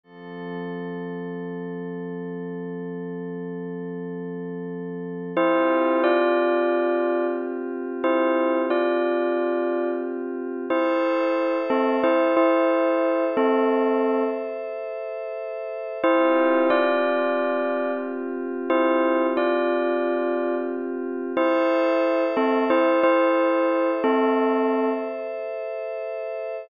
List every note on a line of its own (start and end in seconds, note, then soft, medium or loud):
0.03 5.32 F3 medium
0.03 5.32 C4 medium
0.03 5.32 A4 medium
5.37 10.65 C4 medium
5.37 6.01 E4 medium
5.37 10.65 F4 medium
5.37 10.65 G4 medium
5.37 6.01 C5 medium
6.04 7.25 F4 medium
6.04 7.25 D5 medium
8.04 8.60 E4 medium
8.04 8.60 C5 medium
8.70 9.89 F4 soft
8.70 9.89 D5 medium
10.70 11.58 E4 medium
10.70 15.98 A4 medium
10.70 11.58 C5 medium
10.70 15.98 C5 medium
10.70 15.98 E5 medium
11.70 11.98 C4 medium
11.70 11.98 A4 medium
12.03 12.33 E4 medium
12.03 12.33 C5 medium
12.37 13.24 E4 medium
12.37 13.24 C5 medium
13.37 14.23 C4 medium
13.37 14.23 A4 medium
16.04 21.32 C4 medium
16.04 16.68 E4 medium
16.04 21.32 F4 medium
16.04 21.32 G4 medium
16.04 16.68 C5 medium
16.70 17.92 F4 medium
16.70 17.92 D5 medium
18.70 19.26 E4 medium
18.70 19.26 C5 medium
19.37 20.56 F4 medium
19.37 20.56 D5 medium
21.37 22.24 E4 medium
21.37 26.64 A4 medium
21.37 26.64 C5 medium
21.37 22.24 C5 medium
21.37 26.64 E5 medium
22.37 22.64 C4 medium
22.37 22.64 A4 medium
22.70 22.99 E4 medium
22.70 22.99 C5 medium
23.03 23.91 E4 medium
23.03 23.91 C5 medium
24.04 24.90 C4 medium
24.04 24.90 A4 medium